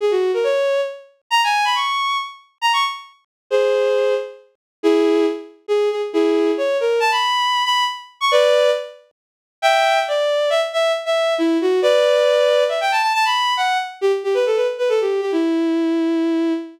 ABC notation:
X:1
M:3/4
L:1/16
Q:1/4=137
K:C#dor
V:1 name="Violin"
G F2 A c4 z4 | a g2 b c'4 z4 | [M:2/4] a c' z6 | [M:3/4] [G^B]6 z6 |
[EG]4 z4 G2 G z | [M:2/4] [EG]4 c2 A2 | [M:3/4] =a b5 b2 z3 c' | [B=d]4 z8 |
[M:2/4] [K:Edor] [eg]4 d4 | [M:3/4] e z e2 z e3 E2 F2 | [Bd]8 e g a a | [M:2/4] a b3 f2 z2 |
[M:3/4] G z G B A B z B A G2 G | E12 |]